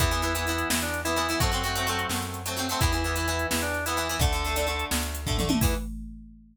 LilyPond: <<
  \new Staff \with { instrumentName = "Drawbar Organ" } { \time 12/8 \key e \minor \tempo 4. = 171 e'2. e'8 d'4 e'4. | fis'2. r2. | e'2. e'8 d'4 e'4. | a'2. r2. |
e'4. r1 r8 | }
  \new Staff \with { instrumentName = "Acoustic Guitar (steel)" } { \time 12/8 \key e \minor <e b>8 <e b>8 <e b>8 <e b>8 <e b>2~ <e b>8 <e b>8 <e b>8 <e b>8 | <fis a c'>8 <fis a c'>8 <fis a c'>8 <fis a c'>8 <fis a c'>2~ <fis a c'>8 <fis a c'>8 <fis a c'>8 <fis a c'>8 | <e b>8 <e b>8 <e b>8 <e b>8 <e b>2~ <e b>8 <e b>8 <e b>8 <e b>8 | <d a>8 <d a>8 <d a>8 <d a>8 <d a>2~ <d a>8 <d a>8 <d a>8 <d a>8 |
<e b>4. r1 r8 | }
  \new Staff \with { instrumentName = "Electric Bass (finger)" } { \clef bass \time 12/8 \key e \minor e,2. e,2. | fis,2. fis,2. | e,2. e,2. | d,2. d,2. |
e,4. r1 r8 | }
  \new DrumStaff \with { instrumentName = "Drums" } \drummode { \time 12/8 <hh bd>8 hh8 hh8 hh8 hh8 hh8 sn8 hh8 hh8 hh8 hh8 hh8 | <hh bd>8 hh8 hh8 hh8 hh8 hh8 sn8 hh8 hh8 hh8 hh8 hh8 | <hh bd>8 hh8 hh8 hh8 hh8 hh8 sn8 hh8 hh8 hh8 hh8 hh8 | <hh bd>8 hh8 hh8 hh8 hh8 hh8 sn8 hh8 hh8 <bd tomfh>8 toml8 tommh8 |
<cymc bd>4. r4. r4. r4. | }
>>